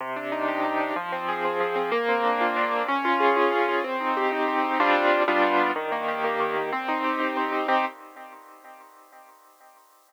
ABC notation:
X:1
M:6/8
L:1/8
Q:3/8=125
K:Cm
V:1 name="Acoustic Grand Piano"
C, D E G E D | F, C A C F, C | B, C D F D C | _D F A F D F |
C E G E C E | [G,CDF]3 [G,=B,DF]3 | E, B, G B, E, B, | C E G E C E |
[CEG]3 z3 |]